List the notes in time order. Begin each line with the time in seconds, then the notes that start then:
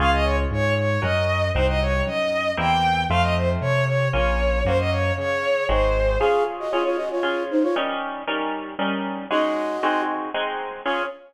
0.00 C#2 C#4 F4 G#4 F5
0.13 D#5
0.24 C#5
0.51 G#2 C#5
0.78 C#5
1.02 F#2 C#4 F#4 A#4 D#5
1.54 C2 C4 D#4 F#4 C5
1.68 D#5
1.81 C#5
2.06 F#2 D#5
2.57 E2 A#3 C4 E4 G4 G5
3.09 F2 A3 C4 F4 F5
3.22 D#5
3.37 C5
3.61 C3 C#5
3.86 C#5
4.13 A#1 A#3 C#4 F4 C#5
4.65 F#2 A#3 C#4 F#4 C5
4.78 D#5
4.91 C#5
5.18 C#3 C#5
5.69 G#1 G#3 C4 D#4 F#4 C5
6.19 C#4 F4 G#4 F5
6.60 F#4 D#5
6.71 C#4 F4 G#4 C#5
6.85 F4 C#5
6.97 F#4 D#5
7.11 F4 C#5
7.23 C#4 F4 G#4
7.51 D#4 C5
7.63 F4 C#5
7.76 G3 C#4 D#4 A#4
8.27 G3 C#4 D#4 A#4
8.79 G3 C#4 D#4 A#4
9.30 G#3 C#4 D#4 F#4 D#5
9.83 G#3 C4 D#4 F#4
10.34 G#3 C4 D#4 F#4
10.85 C#4 F4 G#4 C#5